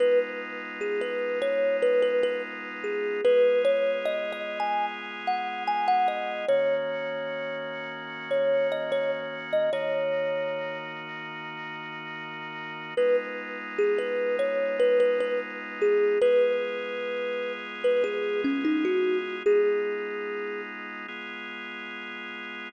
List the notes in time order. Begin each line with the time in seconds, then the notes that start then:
0.00 G#3 B3 D#4 F4 B4
0.81 G#4
1.01 B4
1.42 C#5
1.82 B4
2.02 B4
2.23 B4
2.84 G#4
3.24 G#3 B3 F4 G#4 B4
3.65 C#5
4.05 D#5
4.32 D#5
4.60 G#5
5.27 F#5
5.67 G#5
5.88 F#5
6.08 D#5
6.48 D#3 A#3 C#4 F#4 C#5
8.31 C#5
8.72 D#5
8.92 C#5
9.53 D#5
9.73 D#3 A#3 D#4 F#4 C#5
12.97 G#3 B3 D#4 F4 B4
13.78 G#4
13.98 B4
14.39 C#5
14.80 B4
15.00 B4
15.20 B4
15.81 G#4
16.22 G#3 B3 F4 G#4 B4
17.84 B4
18.04 G#4
18.44 C#4
18.65 D#4
18.85 F#4
19.46 G#3 B3 D#4 F4 G#4
21.08 G#3 B3 F4 G#4